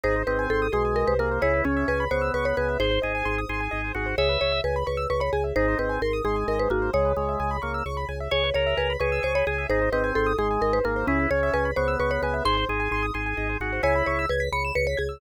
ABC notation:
X:1
M:6/8
L:1/16
Q:3/8=87
K:C#dor
V:1 name="Marimba"
^B2 =B2 =A2 G2 ^A B A2 | c2 C2 B2 =c2 B ^c B2 | ^B8 z4 | c2 c2 B2 B2 B c G2 |
^B2 =B2 A2 G2 A B F2 | c8 z4 | c2 c2 B2 B2 ^B c G2 | ^B2 =B2 =A2 G2 ^A B A2 |
C2 c2 B2 =c2 B ^c B2 | ^b8 z4 | c2 c2 B2 b2 B c G2 |]
V:2 name="Drawbar Organ"
D2 ^B,4 G,4 A,2 | E2 C4 B,4 B,2 | ^B2 G4 G4 F2 | e4 z8 |
D2 ^B,2 z2 G,4 A,2 | G,2 G,4 A,2 z4 | c2 A4 G4 G2 | D2 ^B,4 G,4 A,2 |
E2 C4 B,4 B,2 | ^B2 G4 G4 F2 | E4 z8 |]
V:3 name="Acoustic Grand Piano"
G ^B d g ^b d' b g d B G B | G B c e g b c' e' c' b g e | G ^B d g ^b d' b g d B G B | G B c e g b c' e' c' b g e |
G ^B d g ^b d' b g d B G B | G B c e g b c' e' c' b g e | G B c e g b c' e' c' b g e | G ^B d g ^b d' b g d B G B |
G B c e g b c' e' c' b g e | G ^B d g ^b d' b g d B G B | g b c' e' g' b' c'' e'' c'' b' g' e' |]
V:4 name="Drawbar Organ" clef=bass
G,,,2 G,,,2 G,,,2 B,,,3 ^B,,,3 | C,,2 C,,2 C,,2 C,,2 C,,2 C,,2 | G,,,2 G,,,2 G,,,2 G,,,2 G,,,2 G,,,2 | C,,2 C,,2 C,,2 C,,2 C,,2 C,,2 |
G,,,2 G,,,2 G,,,2 G,,,2 G,,,2 G,,,2 | C,,2 C,,2 C,,2 C,,2 C,,2 C,,2 | C,,2 C,,2 C,,2 C,,2 C,,2 C,,2 | G,,,2 G,,,2 G,,,2 G,,,2 G,,,2 G,,,2 |
C,,2 C,,2 C,,2 C,,2 C,,2 C,,2 | G,,,2 G,,,2 G,,,2 G,,,2 G,,,2 G,,,2 | C,,2 C,,2 C,,2 C,,2 C,,2 C,,2 |]